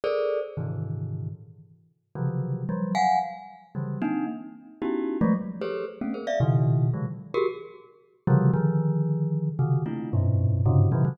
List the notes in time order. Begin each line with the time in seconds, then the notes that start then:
0.04 G#4 A4 A#4 C5 D5
0.57 G#2 A#2 C3 D3 D#3 E3
2.15 C3 C#3 D3 E3 F3 F#3
2.69 F3 F#3 G3
2.95 F5 F#5 G#5
3.75 C#3 D3 E3 F#3 G3
4.02 A#3 C4 D4 D#4
4.82 B3 C#4 D#4 E4 F#4 G4
5.21 F3 F#3 G#3 A3
5.62 G4 G#4 A4 B4 C5 C#5
6.01 A3 A#3 B3 C4 C#4
6.14 G#4 A#4 C5
6.27 D5 E5 F5
6.40 A#2 B2 C#3 D#3
6.94 C3 D3 E3 F#3 G#3
7.34 F#4 G4 G#4 A#4
8.27 C3 C#3 D3 E3 F3 G3
8.54 D3 D#3 F3
9.59 C3 C#3 D#3
9.86 A3 A#3 C4 D4 E4 F4
10.13 F#2 G2 G#2 A#2 B2
10.66 G2 G#2 A#2 C3 C#3
10.92 A#2 B2 C#3 D#3 F3 F#3
11.05 C3 C#3 D#3 E3 F#3